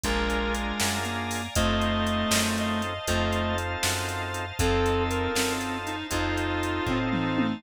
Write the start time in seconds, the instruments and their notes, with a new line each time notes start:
0.04 electric bass (finger) A#1, clarinet G#3 A#4, drawbar organ D4 F4 G#4 A#4 D5 F5 G#5 A#5, kick, closed hi-hat
0.30 closed hi-hat
0.55 closed hi-hat
0.80 electric bass (finger) F#2, snare
1.05 clarinet A#3, closed hi-hat
1.31 open hi-hat
1.55 electric bass (finger) F2, clarinet A3 D#5, drawbar organ C4 D#4 F4 A4 C5 D#5 F5 A5, kick, closed hi-hat
1.82 closed hi-hat
2.07 closed hi-hat
2.31 electric bass (finger) F#2, snare
2.58 clarinet D#5, closed hi-hat
2.82 closed hi-hat
3.07 electric bass (finger) F2, clarinet A3, drawbar organ C4 D#4 F4 A4 C5 D#5 F5 A5, kick, closed hi-hat
3.32 closed hi-hat
3.58 closed hi-hat
3.83 electric bass (finger) F#2, snare
4.09 closed hi-hat
4.34 closed hi-hat
4.59 electric bass (finger) F2, drawbar organ C4 D#4 F4 A4 C5 D#5 F5 A5, clarinet C4 A4, kick, closed hi-hat
4.86 closed hi-hat
5.10 clarinet A#4, closed hi-hat
5.35 electric bass (finger) F#2, clarinet C4, snare
5.61 closed hi-hat
5.87 clarinet D#4, closed hi-hat
6.10 electric bass (finger) F2, drawbar organ C4 D#4 F4 A4 C5 D#5 F5 A5, clarinet D#4 F4, kick, closed hi-hat
6.38 closed hi-hat
6.63 closed hi-hat
6.86 electric bass (finger) A2, clarinet C4, kick, floor tom
7.13 clarinet D#4, mid tom
7.38 high tom